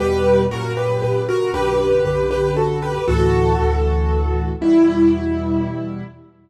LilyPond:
<<
  \new Staff \with { instrumentName = "Acoustic Grand Piano" } { \time 3/4 \key e \minor \tempo 4 = 117 <g' b'>4 <fis' ais'>8 <g' b'>8 <g' b'>8 <fis' ais'>8 | <g' b'>4 <g' b'>8 <g' b'>8 <fis' a'>8 <g' b'>8 | <fis' a'>2. | e'2. | }
  \new Staff \with { instrumentName = "Acoustic Grand Piano" } { \clef bass \time 3/4 \key e \minor <e, b, g>4 <fis, ais, cis>4 <fis, ais, cis>4 | <b,, fis, d>4 <b,, fis, d>2 | <d, a, e>4 <d, a, e>2 | <e, b, g>2. | }
>>